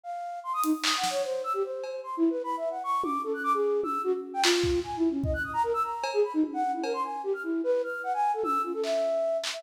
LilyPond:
<<
  \new Staff \with { instrumentName = "Flute" } { \time 4/4 \tempo 4 = 150 f''4 c'''16 dis'''16 dis'16 r16 \tuplet 3/2 { dis'''8 fis''8 cis''8 } c''8 e'''16 g'16 | c''4 \tuplet 3/2 { c'''8 e'8 b'8 b''8 e''8 fis''8 } cis'''8 d'''8 | a'16 fis'''16 d'''16 gis'8. e'''8 fis'16 r8 g''16 f'4 | \tuplet 3/2 { gis''8 e'8 cis'8 } dis''16 fis'''16 dis'''16 ais''16 ais'16 e'''16 ais''8. gis'16 b''16 dis'16 |
r16 fis''8 e'16 ais'16 c'''16 gis''8 g'16 f'''16 e'8 b'8 f'''8 | fis''16 gis''8 a'16 e'''8 f'16 a'16 e''4. r16 e''16 | }
  \new DrumStaff \with { instrumentName = "Drums" } \drummode { \time 4/4 r4 r8 hh8 hc8 sn8 r4 | r8 cb8 r4 r4 r8 tommh8 | r4 r8 tommh8 r4 hc8 bd8 | r4 bd4 r4 cb4 |
tommh4 cb4 r4 r4 | r4 tommh4 hc4 r8 hc8 | }
>>